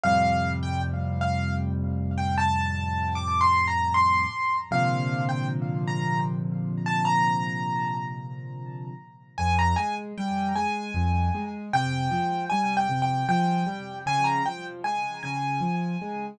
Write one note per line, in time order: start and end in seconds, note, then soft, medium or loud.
0.03 4.25 F2 medium
0.03 4.25 A2 medium
0.03 4.25 C3 medium
0.03 4.25 G3 medium
0.03 0.51 F5 loud
0.63 0.81 G5 medium
1.21 1.54 F5 medium
2.18 2.36 G5 medium
2.38 3.13 A5 medium
3.15 3.40 D6 medium
3.41 3.65 C6 medium
3.68 3.92 A#5 medium
3.94 4.57 C6 medium
4.71 8.92 A#2 medium
4.71 8.92 C3 medium
4.71 8.92 D3 medium
4.71 8.92 F3 medium
4.71 5.24 F5 medium
5.29 5.47 G5 medium
5.88 6.20 A#5 medium
6.86 7.05 A5 medium
7.05 8.05 A#5 medium
9.38 9.74 F2 loud
9.38 9.56 G#5 medium
9.59 9.77 A#5 medium
9.76 10.13 G#3 medium
9.76 9.95 G#5 medium
10.18 10.53 G3 medium
10.18 10.54 G5 medium
10.56 10.91 G#3 medium
10.56 11.50 G#5 medium
10.94 11.29 F2 loud
11.35 11.70 G#3 medium
11.73 12.08 C3 medium
11.73 12.44 G5 loud
12.11 12.46 F3 medium
12.50 12.87 G3 medium
12.50 12.74 G#5 medium
12.77 13.01 G5 medium
12.89 13.24 C3 medium
13.02 13.27 G5 medium
13.29 13.64 F3 loud
13.29 13.99 G5 medium
13.67 14.02 G3 medium
14.06 14.41 C#3 loud
14.06 14.25 G#5 loud
14.24 14.43 A#5 medium
14.45 14.81 F3 medium
14.45 14.64 G5 medium
14.84 15.19 G#3 medium
14.84 15.20 G#5 medium
15.23 15.59 C#3 medium
15.23 16.26 G#5 medium
15.61 15.96 F3 medium
16.02 16.37 G#3 medium